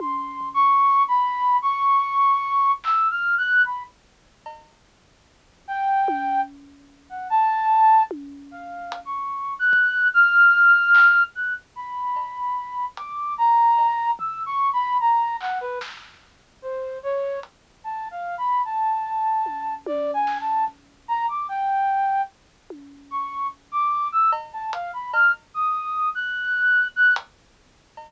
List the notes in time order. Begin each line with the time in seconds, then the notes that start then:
0.00 C6, high tom
0.41 floor tom
0.54 C#6
1.08 B5
1.62 C#6
2.84 E6, clap
3.11 F6
3.38 F#6
3.65 B5, kick
4.46 cowbell
5.68 G5
6.08 high tom
7.09 F#5
7.30 A5
8.11 high tom
8.51 F5
8.92 closed hi-hat
9.05 C#6
9.59 F#6
9.73 kick
10.14 F6
10.95 clap
11.35 F#6
11.76 B5
12.16 cowbell
12.97 D6, closed hi-hat
13.38 A#5
13.78 cowbell
14.19 E6, floor tom
14.46 C#6
14.73 B5
15.00 A#5
15.40 F#5, clap
15.61 B4
15.81 snare
16.62 C5
17.03 C#5
17.43 closed hi-hat
17.84 A5
18.11 F5
18.38 B5
18.65 A5
19.46 high tom
19.86 D5, high tom
20.14 G#5
20.27 snare
20.40 A5
20.68 kick
21.08 A#5
21.28 D6
21.49 G5
22.70 high tom
23.11 C#6
23.72 D6
24.12 E6
24.32 cowbell
24.53 A5
24.73 F5, closed hi-hat
24.93 B5
25.13 F6, cowbell
25.54 D#6
26.15 F#6
26.96 F#6
27.16 closed hi-hat
27.97 cowbell